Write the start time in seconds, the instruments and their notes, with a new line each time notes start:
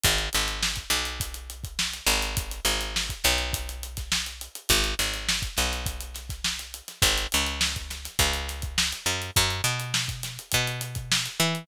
0.04 electric bass (finger) G#1, kick, closed hi-hat
0.18 closed hi-hat
0.33 electric bass (finger) G#1, closed hi-hat
0.47 snare, closed hi-hat
0.63 snare
0.76 kick, closed hi-hat
0.90 electric bass (finger) B1, snare, closed hi-hat
1.05 closed hi-hat
1.20 kick, closed hi-hat
1.34 closed hi-hat
1.50 closed hi-hat
1.64 kick, closed hi-hat
1.79 snare
1.92 snare, closed hi-hat
2.07 electric bass (finger) G#1, closed hi-hat
2.22 closed hi-hat
2.37 kick, closed hi-hat
2.51 closed hi-hat
2.65 electric bass (finger) G#1, closed hi-hat
2.81 closed hi-hat
2.96 snare
3.09 kick, closed hi-hat
3.24 electric bass (finger) B1, snare, closed hi-hat
3.38 snare, closed hi-hat
3.53 kick, closed hi-hat
3.69 closed hi-hat
3.83 closed hi-hat
3.97 kick, snare, closed hi-hat
4.12 snare
4.26 closed hi-hat
4.41 closed hi-hat
4.55 closed hi-hat
4.69 electric bass (finger) G#1, kick, closed hi-hat
4.84 closed hi-hat
4.99 electric bass (finger) G#1, snare, closed hi-hat
5.14 snare, closed hi-hat
5.29 snare
5.42 kick, closed hi-hat
5.57 electric bass (finger) B1, snare, closed hi-hat
5.72 snare, closed hi-hat
5.86 kick, closed hi-hat
6.00 closed hi-hat
6.14 snare, closed hi-hat
6.29 kick, snare, closed hi-hat
6.44 snare
6.59 snare, closed hi-hat
6.74 closed hi-hat
6.88 snare, closed hi-hat
7.02 electric bass (finger) G#1, kick, closed hi-hat
7.18 closed hi-hat
7.32 electric bass (finger) C#2, closed hi-hat
7.46 closed hi-hat
7.61 snare
7.76 kick, closed hi-hat
7.90 snare, closed hi-hat
8.05 snare, closed hi-hat
8.19 electric bass (finger) C#2, kick, closed hi-hat
8.33 closed hi-hat
8.48 snare, closed hi-hat
8.62 kick, closed hi-hat
8.78 snare
8.92 closed hi-hat
9.06 electric bass (finger) F#2, closed hi-hat
9.22 closed hi-hat
9.36 electric bass (finger) F#2, kick, closed hi-hat
9.50 closed hi-hat
9.64 electric bass (finger) B2, snare, closed hi-hat
9.80 closed hi-hat
9.94 snare
10.08 kick, closed hi-hat
10.23 snare, closed hi-hat
10.39 closed hi-hat
10.52 electric bass (finger) B2, kick, closed hi-hat
10.67 closed hi-hat
10.81 closed hi-hat
10.95 kick, closed hi-hat
11.12 snare
11.26 snare, closed hi-hat
11.39 electric bass (finger) E3, snare, closed hi-hat
11.55 closed hi-hat